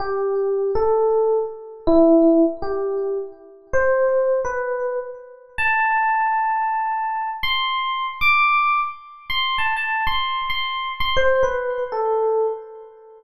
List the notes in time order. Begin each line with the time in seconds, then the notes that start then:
0.00 G4
0.75 A4
1.87 E4
2.62 G4
3.73 C5
4.45 B4
5.58 A5
7.43 C6
8.21 D6
9.30 C6
9.58 A5
9.76 A5
10.07 C6
10.50 C6
11.00 C6
11.17 C5
11.43 B4
11.92 A4